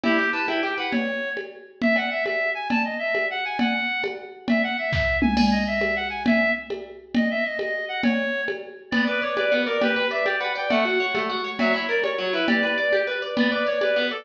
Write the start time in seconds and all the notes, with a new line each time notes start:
0.04 E4 G4, cowbell, low conga
0.18 G4
0.33 B4 A5
0.48 E4 G5, cowbell, high conga
0.63 G4 G5
0.78 B4 F#5
0.91 C#5, cowbell, low conga
1.37 cowbell, high conga
1.82 E5, low conga
1.96 F#5, cowbell
2.11 E5
2.25 E5, cowbell, high conga
2.55 G#5
2.70 A5, cowbell, low conga
2.85 D#5
2.99 E5
3.15 cowbell, high conga
3.31 F#5
3.45 G#5
3.59 F#5, cowbell, low conga
4.04 cowbell, high conga
4.48 E5, cowbell, low conga
4.63 F#5
4.78 E5
4.93 E5, kick, snare
5.22 G#5, mid tom
5.37 G#5, crash, cowbell, low conga
5.52 D#5
5.67 E5
5.81 cowbell, high conga
5.96 F#5
6.10 G#5
6.26 E5, cowbell, low conga
6.70 cowbell, high conga
7.15 D#5, cowbell, low conga
7.31 E5
7.44 D#5
7.59 D#5, cowbell, high conga
7.89 F#5
8.03 C#5, cowbell, low conga
8.48 cowbell, high conga
8.91 B3 D5, cowbell, low conga
9.07 B4 D5
9.22 C#5 D5
9.36 B4 D5, cowbell, high conga
9.52 B3
9.66 A#4 D5
9.81 G4 B4, cowbell, low conga
9.96 B4
10.11 D5 E5
10.26 G4 D5, cowbell, high conga
10.39 B4 F#5
10.55 D5 G5
10.69 A3 F#5, cowbell, low conga
10.85 F#4
11.00 C#5
11.15 A3, cowbell, high conga
11.29 F#4
11.44 C#5
11.59 F#3 E5, cowbell, low conga
11.74 E4 C#5
11.89 A#4 D5
12.04 C#5, cowbell, high conga
12.18 F#3
12.33 E4 B4
12.47 G4 D5, cowbell, low conga
12.63 B4
12.78 D5
12.93 G4, cowbell, high conga
13.07 B4
13.22 D5
13.37 B3 D5, cowbell, low conga
13.51 B4 D5
13.67 C#5 D5
13.81 B4 D5, cowbell, high conga
13.96 B3
14.11 A4 D5